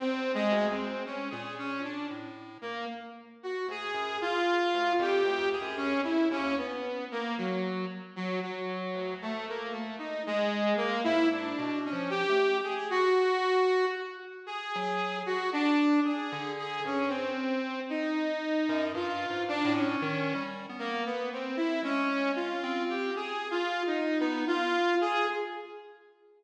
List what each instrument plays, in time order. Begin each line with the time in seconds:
0.00 lead 1 (square) E2, lead 2 (sawtooth) C4
0.34 lead 2 (sawtooth) G#3
0.52 lead 1 (square) D2
0.71 lead 2 (sawtooth) C4
1.05 lead 2 (sawtooth) C#4
1.30 lead 1 (square) A#2, lead 2 (sawtooth) G#4
1.58 lead 2 (sawtooth) C#4
1.84 lead 2 (sawtooth) D4
2.10 lead 1 (square) A2
2.61 lead 2 (sawtooth) A#3
3.43 lead 2 (sawtooth) F#4
3.68 lead 1 (square) D2, lead 2 (sawtooth) G#4
3.94 lead 1 (square) F#2
4.21 lead 2 (sawtooth) F4
4.74 lead 1 (square) D2
4.99 lead 1 (square) F2, lead 2 (sawtooth) G4
5.24 lead 1 (square) D2
5.52 lead 2 (sawtooth) G#4
5.61 lead 1 (square) F#2
5.77 lead 2 (sawtooth) C#4
5.96 lead 1 (square) F2
6.04 lead 2 (sawtooth) E4
6.31 lead 1 (square) D#2, lead 2 (sawtooth) C#4
6.57 lead 2 (sawtooth) B3
7.11 lead 2 (sawtooth) A#3
7.38 lead 2 (sawtooth) F#3
8.16 lead 2 (sawtooth) F#3
8.43 lead 2 (sawtooth) F#3
8.95 lead 1 (square) D2
9.22 lead 2 (sawtooth) A3
9.48 lead 2 (sawtooth) A#3
9.72 lead 2 (sawtooth) A3
9.98 lead 2 (sawtooth) D#4
10.27 lead 2 (sawtooth) G#3
10.77 lead 2 (sawtooth) A#3
11.04 lead 1 (square) G#2, lead 2 (sawtooth) E4
11.31 lead 2 (sawtooth) D4
11.59 lead 1 (square) B2
11.85 lead 2 (sawtooth) C#4
11.92 lead 1 (square) F3
12.10 lead 2 (sawtooth) G4
12.29 lead 1 (square) A3
12.64 lead 2 (sawtooth) G#4
12.90 lead 2 (sawtooth) F#4
14.46 lead 2 (sawtooth) G#4
14.75 lead 1 (square) F#3
15.26 lead 2 (sawtooth) F#4
15.53 lead 2 (sawtooth) D4
16.04 lead 2 (sawtooth) G#4
16.32 lead 1 (square) D3
16.58 lead 2 (sawtooth) G#4
16.84 lead 1 (square) G2, lead 2 (sawtooth) C#4
17.09 lead 2 (sawtooth) C4
17.89 lead 2 (sawtooth) D#4
18.69 lead 1 (square) F#2
18.94 lead 1 (square) G2, lead 2 (sawtooth) F4
19.30 lead 1 (square) G#2
19.48 lead 2 (sawtooth) D4
19.64 lead 1 (square) A2
19.72 lead 2 (sawtooth) C#4
20.02 lead 1 (square) D#3
20.35 lead 1 (square) G3
20.69 lead 1 (square) B3
20.79 lead 2 (sawtooth) A#3
21.05 lead 2 (sawtooth) B3
21.32 lead 2 (sawtooth) C4
21.56 lead 2 (sawtooth) E4
21.83 lead 1 (square) G#3, lead 2 (sawtooth) C#4
22.36 lead 2 (sawtooth) F4
22.63 lead 1 (square) C4
22.89 lead 2 (sawtooth) G4
23.16 lead 2 (sawtooth) G#4
23.51 lead 2 (sawtooth) F4
23.87 lead 2 (sawtooth) D#4
24.20 lead 2 (sawtooth) B3, lead 1 (square) D#4
24.47 lead 2 (sawtooth) F4
25.01 lead 2 (sawtooth) G#4